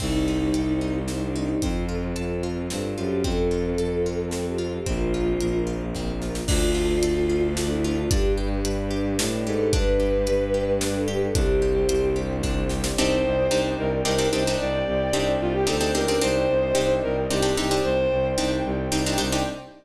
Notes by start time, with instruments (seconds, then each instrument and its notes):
0.00 violin C2, orchestral harp C4, string ensemble 1 C4 D#4 G4, choir aahs D#4, kick, crash
0.28 orchestral harp D#4
0.54 violin C2, orchestral harp G4, closed hi-hat
0.81 orchestral harp D#4
1.08 orchestral harp C4, choir aahs D#4, snare
1.22 choir aahs D4
1.35 choir aahs D4, orchestral harp D#4
1.49 choir aahs D#4
1.62 violin F2, string ensemble 1 C4 F4 A4, orchestral harp C4, choir aahs F4, kick, closed hi-hat
1.89 orchestral harp F4
2.16 violin F2, orchestral harp A4, closed hi-hat
2.43 orchestral harp F4
2.70 violin G2, orchestral harp C4, snare
2.97 violin F#2, orchestral harp F4, choir aahs G4
3.24 violin F2, string ensemble 1 C4 F4 A4, orchestral harp C4, choir aahs A4, kick, closed hi-hat
3.51 orchestral harp F4
3.78 violin F2, orchestral harp A4, closed hi-hat
4.06 orchestral harp F4
4.31 orchestral harp C4, choir aahs A4, snare
4.46 choir aahs G4
4.58 orchestral harp F4, choir aahs F4
4.73 choir aahs G4
4.86 violin A#1, orchestral harp C4, string ensemble 1 C4 F4 A#4, choir aahs F4, kick, closed hi-hat
5.14 orchestral harp F4
5.41 violin A#1, orchestral harp A#4, closed hi-hat
5.67 orchestral harp F4
5.95 orchestral harp C4, kick, snare
6.22 orchestral harp F4, snare
6.35 snare
6.48 violin D2, orchestral harp D4, string ensemble 1 D4 F4 A4, choir aahs F4, kick, crash
6.75 orchestral harp F4
7.03 violin D2, orchestral harp A4, closed hi-hat
7.30 orchestral harp F4
7.57 orchestral harp D4, choir aahs F4, snare
7.70 choir aahs E4
7.84 choir aahs E4, orchestral harp F4
7.97 choir aahs F4
8.11 violin G2, orchestral harp D4, string ensemble 1 D4 G4 B4, choir aahs G4, kick, closed hi-hat
8.38 orchestral harp G4
8.65 violin G2, orchestral harp B4, closed hi-hat
8.91 orchestral harp G4
9.19 violin A2, orchestral harp D4, snare
9.46 violin G#2, orchestral harp G4, choir aahs A4
9.73 violin G2, orchestral harp D4, string ensemble 1 D4 G4 B4, choir aahs B4, kick, closed hi-hat
10.00 orchestral harp G4
10.27 violin G2, orchestral harp B4, closed hi-hat
10.54 orchestral harp G4
10.81 orchestral harp D4, choir aahs B4, snare
10.95 choir aahs A4
11.08 orchestral harp G4, choir aahs G4
11.22 choir aahs A4
11.35 violin C2, orchestral harp D4, string ensemble 1 D4 G4 C5, choir aahs G4, kick, closed hi-hat
11.62 orchestral harp G4
11.89 violin C2, orchestral harp C5, closed hi-hat
12.16 orchestral harp G4
12.43 orchestral harp D4, kick, snare
12.69 orchestral harp G4, snare
12.84 snare
12.97 violin C2 C5, orchestral harp C4 D4 D#4 G4, string ensemble 1 C5 D5 D#5 G5
13.24 violin C2
13.51 violin C2, orchestral harp C4 D4 D#4 G4
13.78 violin C2 A#4
14.05 violin C2 A#4, orchestral harp C4 D4 D#4 G4
14.18 orchestral harp C4 D4 D#4 G4
14.32 violin C2 C5, orchestral harp C4 D4 D#4 G4
14.47 orchestral harp C4 D4 D#4 G4
14.59 violin C2 D5, string ensemble 1 G4 C5 D5 G5
14.86 violin C2
15.13 violin C2, orchestral harp C4 D4 D#4 G4
15.41 violin C2 F4
15.54 violin G4
15.67 violin D2 A4, orchestral harp C4 D4 D#4 G4
15.81 orchestral harp C4 D4 D#4 G4
15.95 violin C#2 A#4, orchestral harp C4 D4 D#4 G4
16.08 orchestral harp C4 D4 D#4 G4
16.21 violin C2 C5, orchestral harp C4 D4 D#4 G4, string ensemble 1 C5 D5 D#5 G5
16.49 violin C2
16.75 violin C2, orchestral harp C4 D4 D#4 G4
17.03 violin C2 A#4
17.30 violin C2 G4, orchestral harp C4 D4 D#4 G4
17.42 orchestral harp C4 D4 D#4 G4
17.57 violin C2 G4, orchestral harp C4 D4 D#4 G4
17.71 orchestral harp C4 D4 D#4 G4
17.84 violin C2 C5, string ensemble 1 G4 C5 D5 G5
18.11 violin C2
18.38 violin C2, orchestral harp C4 D4 D#4 G4
18.65 violin C2
18.92 violin C2, orchestral harp C4 D4 D#4 G4
19.06 orchestral harp C4 D4 D#4 G4
19.18 violin C2, orchestral harp C4 D4 D#4 G4
19.32 orchestral harp C4 D4 D#4 G4